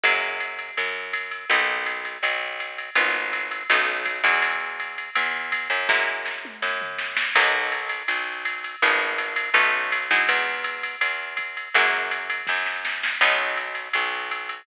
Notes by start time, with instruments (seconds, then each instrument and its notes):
0.04 electric bass (finger) F#2, acoustic guitar (steel) F#3 G#3 A#3 E4, ride
0.40 hi-hat pedal, ride
0.59 ride
0.77 electric bass (finger) F#2, ride
1.13 kick, hi-hat pedal, ride
1.31 ride
1.50 electric bass (finger) B1, acoustic guitar (steel) A#3 B3 D#4 F#4, ride
1.86 hi-hat pedal, ride
2.05 ride
2.23 electric bass (finger) B1, ride
2.59 hi-hat pedal, ride
2.78 ride
2.95 electric bass (finger) G#1, acoustic guitar (steel) G#3 B3 D#4 F4, ride
3.33 hi-hat pedal, ride
3.51 ride
3.70 electric bass (finger) B1, acoustic guitar (steel) A3 B3 C#4 D#4, ride
4.05 kick, hi-hat pedal, ride
4.24 electric bass (finger) E2, acoustic guitar (steel) F#3 G#3 D#4 E4, ride
4.42 ride
4.79 hi-hat pedal, ride
4.98 ride
5.15 electric bass (finger) E2, ride
5.52 kick, hi-hat pedal, ride
5.70 electric bass (finger) F#2, ride
5.89 acoustic guitar (steel) F#3 G#3 A#3 E4, kick, snare
6.25 snare
6.45 mid tom
6.62 electric bass (finger) F#2, snare
6.82 floor tom
6.99 snare
7.17 snare
7.35 electric bass (finger) B1, acoustic guitar (steel) F#3 A#3 B3 D#4, kick, crash, ride
7.71 hi-hat pedal, ride
7.89 ride
8.08 electric bass (finger) B1, ride
8.45 hi-hat pedal, ride
8.64 ride
8.82 electric bass (finger) G#1, acoustic guitar (steel) F3 G#3 B3 D#4, ride
9.18 hi-hat pedal, ride
9.36 ride
9.54 electric bass (finger) B1, acoustic guitar (steel) A3 B3 C#4 D#4, ride
9.92 hi-hat pedal, ride
10.11 acoustic guitar (steel) F#3 G#3 D#4 E4, ride
10.29 electric bass (finger) E2, ride
10.64 hi-hat pedal, ride
10.83 ride
11.01 electric bass (finger) E2, ride
11.37 kick, hi-hat pedal, ride
11.57 ride
11.74 electric bass (finger) F#2, acoustic guitar (steel) F#3 G#3 A#3 E4, ride
12.10 hi-hat pedal, ride
12.30 ride
12.47 electric bass (finger) F#2, kick, snare
12.66 snare
12.85 snare
13.03 snare
13.21 electric bass (finger) B1, acoustic guitar (steel) F#3 B3 C#4 D#4, kick, crash, ride
13.57 hi-hat pedal, ride
13.75 ride
13.93 electric bass (finger) B1, ride
14.31 hi-hat pedal, ride
14.49 ride